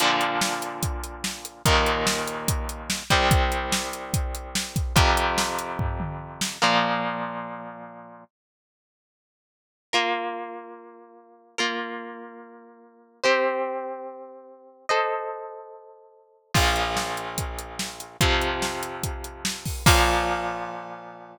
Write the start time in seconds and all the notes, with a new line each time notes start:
0.00 A#2 D3 F3, closed hi-hat
0.21 closed hi-hat
0.41 snare
0.62 closed hi-hat
0.83 kick, closed hi-hat
1.04 closed hi-hat
1.24 snare
1.45 closed hi-hat
1.65 D#2 A#2 D#3, kick, closed hi-hat
1.86 closed hi-hat
2.07 snare
2.27 closed hi-hat
2.48 kick, closed hi-hat
2.69 closed hi-hat
2.90 snare
3.10 C2 C3 G3, kick, closed hi-hat
3.31 kick, closed hi-hat
3.52 closed hi-hat
3.72 snare
3.93 closed hi-hat
4.14 kick, closed hi-hat
4.35 closed hi-hat
4.55 snare
4.76 kick, closed hi-hat
4.96 F2 C3 F3, kick, closed hi-hat
5.17 closed hi-hat
5.38 snare
5.59 closed hi-hat
5.79 kick, floor tom
6.00 mid tom
6.41 snare
6.62 A#2 F3 A#3
9.93 A#3 F4 A#4
11.58 A#3 F4 A#4
13.24 C4 G4 C5
14.89 A4 C5 D#5
16.54 A#1 A#2 F3, kick, crash
16.76 closed hi-hat
16.97 snare
17.17 closed hi-hat
17.38 kick, closed hi-hat
17.59 closed hi-hat
17.79 snare
18.00 closed hi-hat
18.21 F2 C3 F3, kick, closed hi-hat
18.41 closed hi-hat
18.62 snare
18.83 closed hi-hat
19.03 kick, closed hi-hat
19.24 closed hi-hat
19.45 snare
19.65 kick, open hi-hat
19.86 A#2 F3 A#3, kick, crash